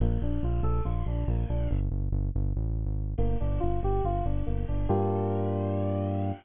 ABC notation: X:1
M:4/4
L:1/16
Q:1/4=141
K:Gm
V:1 name="Electric Piano 2"
B,2 D2 F2 A2 F2 D2 B,2 D2 | [M:7/8] z14 | [M:4/4] B,2 D2 F2 G2 F2 D2 B,2 D2 | [M:7/8] [B,DFG]14 |]
V:2 name="Synth Bass 1" clef=bass
B,,,2 B,,,2 B,,,2 B,,,2 B,,,2 B,,,2 B,,,2 B,,,2 | [M:7/8] G,,,2 G,,,2 G,,,2 G,,,2 A,,,3 _A,,,3 | [M:4/4] G,,,2 G,,,2 G,,,2 G,,,2 G,,,2 G,,,2 G,,,2 G,,,2 | [M:7/8] G,,14 |]